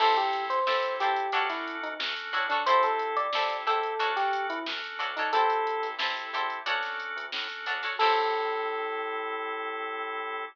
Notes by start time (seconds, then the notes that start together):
0.00 A1 C4 E4 G4 A4 C5, kick, crash
0.17 G4, closed hi-hat
0.33 closed hi-hat
0.49 A1 C5, closed hi-hat
0.66 A1 C4 E4 G4 A4 C5, snare
0.83 kick, closed hi-hat
0.99 A1 E4 G4 A4 C5, snare, closed hi-hat
1.16 closed hi-hat
1.32 D2 C#4 D4 F#4 A4 C#5, kick, closed hi-hat
1.49 E4, snare, closed hi-hat
1.68 closed hi-hat
1.83 D2 D#4, closed hi-hat
1.99 D2 C#4 D4 F#4 A4, snare
2.17 closed hi-hat
2.33 A2 D4 F#4 A4 C#5, closed hi-hat
2.49 D4 F#4 A4 C#5, snare, closed hi-hat
2.66 C2 C4 E4 G4 A4 C5, kick, closed hi-hat
2.83 A4, snare, closed hi-hat
2.99 closed hi-hat
3.16 C2 D5, closed hi-hat
3.33 C2 C4 E4 G4 A4 C5, snare
3.50 kick, closed hi-hat
3.66 E2 E4 G4 A4 C5, closed hi-hat
3.83 closed hi-hat
3.99 D2 C#4 D4 F#4 A4 C#5, kick, closed hi-hat
4.16 G4, snare, closed hi-hat
4.33 closed hi-hat
4.49 D2 E4, closed hi-hat
4.66 D2 C#4 D4 F#4 A4, snare
4.84 closed hi-hat
4.99 D2 D4 F#4 A4 C#5, closed hi-hat
5.17 D4 D#4 F#4 A4 C#5, closed hi-hat
5.33 A1 C4 E4 G4 A4 C5, kick, closed hi-hat
5.50 closed hi-hat
5.67 closed hi-hat
5.83 A1, snare, closed hi-hat
5.99 A1 C4 E4 G4 A4 C5, snare
6.17 kick, closed hi-hat
6.33 E2 E4 G4 A4 C5, closed hi-hat
6.50 closed hi-hat
6.66 D2 C#4 D4 F#4 A4 C#5, kick, closed hi-hat
6.83 snare, closed hi-hat
7.00 closed hi-hat
7.16 D2, closed hi-hat
7.32 A2 C#4 D4 F#4 A4, snare
7.50 closed hi-hat
7.66 D2 D4 F#4 A4 C#5, closed hi-hat
7.83 D4 F#4 A4 C#5, snare, closed hi-hat
7.99 A2 C4 E4 G4 A4 C5, kick, crash